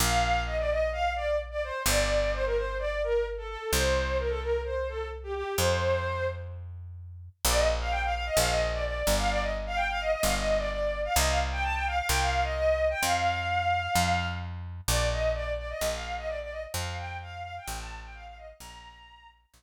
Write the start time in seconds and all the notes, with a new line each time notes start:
0.00 A#1 F5
0.46 D#5
0.58 D5
0.70 D#5
0.92 F5
1.16 D5
1.51 D5
1.64 C5
1.86 G1 D5
2.33 C5
2.45 A#4
2.56 C5
2.79 D5
3.03 A#4
3.37 A4
3.49 A4
3.73 C2 C5
4.19 A#4
4.29 A4
4.41 A#4
4.65 C5
4.89 A4
5.23 G4
5.34 G4
5.57 F2 C5
7.45 A#1 D5
7.56 D#5
7.79 F5
7.90 G5
8.04 F5
8.14 F5
8.26 D#5
8.37 A#1 F5
8.49 D#5
8.73 D5
8.85 D5
9.07 G1
9.18 F5
9.30 D5
9.42 D#5
9.66 F5
9.75 G5
9.89 F5
10.01 D#5
10.12 D#5
10.23 G1 F5
10.36 D#5
10.58 D5
10.70 D5
11.05 F5
11.16 C2 D#5
11.27 F5
11.52 G5
11.63 A5
11.74 G5
11.87 F5
11.98 F5
12.08 C2 G5
12.21 F5
12.43 D#5
12.54 D#5
12.90 G5
13.03 F2 F5
13.95 F2
14.88 A#1 D5
15.11 D#5
15.34 D5
15.58 D5
15.69 D#5
15.81 A#1
15.93 F5
16.17 D#5
16.27 D5
16.41 D5
16.51 D#5
16.74 F2 F5
16.98 G5
17.22 F5
17.43 F5
17.57 G5
17.68 A1
17.79 A5
18.03 G5
18.14 F5
18.26 F5
18.37 D#5
18.60 A#1 A#5
19.54 A#1